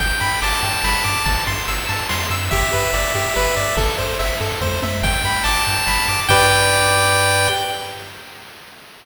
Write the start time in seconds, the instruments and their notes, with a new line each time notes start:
0.00 synth bass 1 G1, lead 1 (square) G5, kick, crash
0.21 synth bass 1 G2, lead 1 (square) B5, ride
0.42 synth bass 1 G1, lead 1 (square) A5 D6, ride
0.63 synth bass 1 G2, lead 1 (square) G5, ride
0.84 synth bass 1 G1, lead 1 (square) B5, snare
1.04 synth bass 1 G2, lead 1 (square) D6, ride
1.26 synth bass 1 G1, lead 1 (square) A5, kick, ride
1.47 synth bass 1 G2, lead 1 (square) C6, ride
1.68 synth bass 1 G1, lead 1 (square) E6, ride
1.89 synth bass 1 G2, lead 1 (square) A5, ride
2.09 synth bass 1 F2, lead 1 (square) C6, snare
2.30 synth bass 1 F#2, lead 1 (square) E6, ride
2.51 synth bass 1 G1, lead 1 (square) G4 E5, kick, ride
2.73 synth bass 1 G2, lead 1 (square) B4, ride
2.93 synth bass 1 G1, lead 1 (square) D5, ride
3.15 synth bass 1 G2, lead 1 (square) G4, ride
3.35 synth bass 1 G1, lead 1 (square) B4, snare
3.57 synth bass 1 G2, lead 1 (square) D5, ride
3.77 synth bass 1 G1, lead 1 (square) A4, kick, ride
3.98 synth bass 1 G2, lead 1 (square) C5, ride
4.19 synth bass 1 G1, lead 1 (square) E5, ride
4.41 synth bass 1 G2, lead 1 (square) A4, ride
4.61 synth bass 1 F2, lead 1 (square) C5, kick, high tom
4.82 synth bass 1 F#2, lead 1 (square) E5, high tom
5.03 synth bass 1 G1, lead 1 (square) G5, kick, crash
5.24 synth bass 1 G2, lead 1 (square) B5, ride
5.44 synth bass 1 G1, lead 1 (square) A5 D6, ride
5.66 synth bass 1 G2, lead 1 (square) G5, ride
5.87 synth bass 1 G1, lead 1 (square) B5, snare
6.08 synth bass 1 G2, lead 1 (square) D6, ride
6.28 synth bass 1 G2, lead 1 (square) G4 B4 D5 G5, kick, crash